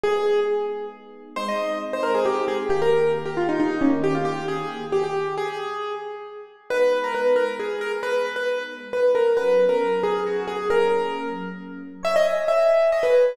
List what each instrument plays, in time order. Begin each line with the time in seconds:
0.03 electric piano 1 G#3 B3 D#4, acoustic grand piano G#4
1.36 electric piano 1 G#3 C4 D#4, acoustic grand piano C5
1.48 acoustic grand piano D#5
1.93 acoustic grand piano C5
2.03 acoustic grand piano A#4
2.15 acoustic grand piano G#4
2.25 acoustic grand piano G4
2.48 acoustic grand piano G#4
2.69 electric piano 1 D#3 A#3 G4, acoustic grand piano G4
2.82 acoustic grand piano A#4
3.25 acoustic grand piano G4
3.37 acoustic grand piano F4
3.49 acoustic grand piano D#4
3.60 acoustic grand piano D#4
3.81 electric piano 1 D#3 A#3 G4, acoustic grand piano C#4
4.04 acoustic grand piano G4
4.15 acoustic grand piano F4
4.25 acoustic grand piano G4
4.48 acoustic grand piano G#4
4.92 acoustic grand piano G4
5.04 acoustic grand piano G4
5.37 acoustic grand piano G#4
6.70 electric piano 1 G#3 B3 D#4, acoustic grand piano B4
7.04 acoustic grand piano A#4
7.15 acoustic grand piano B4
7.36 acoustic grand piano A#4
7.59 acoustic grand piano G#4
7.81 acoustic grand piano A#4
8.03 acoustic grand piano B4
8.36 acoustic grand piano B4
8.93 acoustic grand piano B4
9.15 acoustic grand piano A#4
9.37 electric piano 1 F#3 B3 C#4, acoustic grand piano B4
9.69 acoustic grand piano A#4
10.03 acoustic grand piano G#4
10.26 acoustic grand piano F#4
10.47 acoustic grand piano G#4
10.70 electric piano 1 F#3 A#3 C#4, acoustic grand piano A#4
12.03 electric piano 1 C#5, acoustic grand piano E5
12.16 acoustic grand piano D#5
12.25 electric piano 1 G#5
12.47 electric piano 1 E5, acoustic grand piano E5
12.70 electric piano 1 G#5
12.92 electric piano 1 C#5, acoustic grand piano D#5
13.03 acoustic grand piano B4
13.14 electric piano 1 G#5